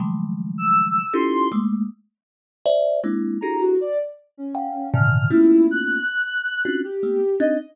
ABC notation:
X:1
M:5/4
L:1/16
Q:1/4=79
K:none
V:1 name="Kalimba"
[_D,_E,F,_G,_A,=A,]6 [_D_E=EF=GA]2 [_A,=A,_B,]2 z4 [c=de]2 [_A,B,C=DE]2 [DE_G=G_A=A]2 | z4 [f_g=g]2 [_A,,_B,,C,D,_E,]2 [=A,_B,=B,_D_EF]4 z3 [CD=DEF_G] z [A,_B,=B,] z [CDE] |]
V:2 name="Ocarina"
z3 e'3 c'2 z10 _b _G | d z2 _D3 f'2 E2 _g'6 =G3 _e |]